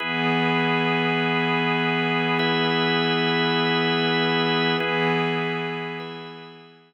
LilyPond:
<<
  \new Staff \with { instrumentName = "Pad 5 (bowed)" } { \time 3/4 \key e \major \tempo 4 = 75 <e b gis'>2.~ | <e b gis'>2. | <e b gis'>2. | }
  \new Staff \with { instrumentName = "Drawbar Organ" } { \time 3/4 \key e \major <e' gis' b'>2. | <e' b' e''>2. | <e' gis' b'>4. <e' b' e''>4. | }
>>